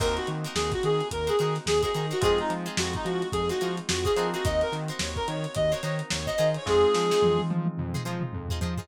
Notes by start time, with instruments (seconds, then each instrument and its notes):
0.00 synth bass 1 D#2, electric piano 2 A#3 C4 D#4 F#4, acoustic guitar (steel) D#4 F#4 A#4 C5, clarinet A#4, kick, crash
0.17 clarinet F#4, closed hi-hat
0.27 synth bass 1 D#3, closed hi-hat
0.44 acoustic guitar (steel) D#4 F#4 A#4 C5, snare, closed hi-hat
0.55 synth bass 1 D#2, clarinet G#4, snare
0.72 clarinet F#4, kick, snare, closed hi-hat
0.83 synth bass 1 D#3, clarinet G#4, closed hi-hat
1.00 closed hi-hat
1.11 synth bass 1 D#2, clarinet A#4, kick, closed hi-hat
1.27 acoustic guitar (steel) D#4 F#4 A#4 C5, clarinet G#4, closed hi-hat
1.39 synth bass 1 D#3, acoustic guitar (steel) D#4 F#4 A#4 C5, closed hi-hat
1.55 snare, closed hi-hat
1.66 synth bass 1 D#2, clarinet G#4, snare
1.82 acoustic guitar (steel) D#4 F#4 A#4 C5, clarinet G#4, kick, closed hi-hat
1.94 synth bass 1 D#3, acoustic guitar (steel) D#4 F#4 A#4 C5, closed hi-hat
2.11 acoustic guitar (steel) D#4 F#4 A#4 C5, clarinet F#4, closed hi-hat
2.21 synth bass 1 F2, electric piano 2 G#3 C4 D#4 F4, acoustic guitar (steel) F4 G#4 C5, clarinet G#4, kick, closed hi-hat
2.25 acoustic guitar (steel) D#4
2.38 clarinet D#4, closed hi-hat
2.50 synth bass 1 F3, closed hi-hat
2.66 acoustic guitar (steel) D#4 F4 G#4 C5, closed hi-hat
2.77 synth bass 1 F2, clarinet F#4, snare
2.93 clarinet D#4, kick, closed hi-hat
3.05 synth bass 1 F3, clarinet F#4, closed hi-hat
3.22 closed hi-hat
3.32 synth bass 1 F2, clarinet G#4, kick, closed hi-hat
3.49 acoustic guitar (steel) D#4 F4 G#4 C5, clarinet F#4, closed hi-hat
3.61 synth bass 1 F3, acoustic guitar (steel) D#4 F4 G#4 C5, closed hi-hat
3.77 closed hi-hat
3.89 synth bass 1 F2, clarinet F#4, snare
4.04 acoustic guitar (steel) D#4 F4 G#4 C5, clarinet G#4, kick, closed hi-hat
4.16 synth bass 1 F3, electric piano 2 A#3 C4 D#4 F#4, acoustic guitar (steel) D#4 F4 G#4 C5, closed hi-hat
4.34 acoustic guitar (steel) D#4 F4 G#4 C5, clarinet F#4, closed hi-hat
4.44 synth bass 1 D#2, acoustic guitar (steel) D#4 F#4 A#4 C5, clarinet D#5, kick, closed hi-hat
4.61 clarinet A#4, closed hi-hat
4.72 synth bass 1 D#3, snare, closed hi-hat
4.88 acoustic guitar (steel) D#4 F#4 A#4 C5, closed hi-hat
4.99 synth bass 1 D#2, clarinet C#5, snare
5.16 clarinet A#4, kick, closed hi-hat
5.28 synth bass 1 D#3, clarinet C#5, closed hi-hat
5.44 closed hi-hat
5.55 synth bass 1 D#2, clarinet D#5, kick, closed hi-hat
5.71 acoustic guitar (steel) D#4 F#4 A#4 C5, clarinet C#5, closed hi-hat
5.83 synth bass 1 D#3, acoustic guitar (steel) D#4 F#4 A#4 C5, snare, closed hi-hat
5.99 closed hi-hat
6.10 synth bass 1 D#2, clarinet C#5, snare
6.26 acoustic guitar (steel) D#4 F#4 A#4 C5, clarinet D#5, kick, closed hi-hat
6.38 synth bass 1 D#3, acoustic guitar (steel) D#4 F4 G#4 C5, snare, closed hi-hat
6.54 clarinet C#5, closed hi-hat
6.66 synth bass 1 F2, electric piano 2 G#3 C4 D#4 F4, clarinet G#4, kick, snare
6.94 synth bass 1 F3, snare
7.11 acoustic guitar (steel) D#4 F4 G#4 C5, snare
7.22 synth bass 1 F2, high tom
7.39 high tom
7.50 synth bass 1 F3, high tom
7.66 high tom
7.78 synth bass 1 F2, mid tom
7.94 acoustic guitar (steel) D#4 F4 G#4 C5, mid tom
8.05 synth bass 1 F3, acoustic guitar (steel) D#4 F4 G#4 C5
8.21 mid tom
8.33 synth bass 1 F2, floor tom
8.49 acoustic guitar (steel) D#4 F4 G#4 C5, floor tom
8.61 synth bass 1 F3, acoustic guitar (steel) D#4 F4 G#4 C5, floor tom
8.77 acoustic guitar (steel) D#4 F4 G#4 C5, floor tom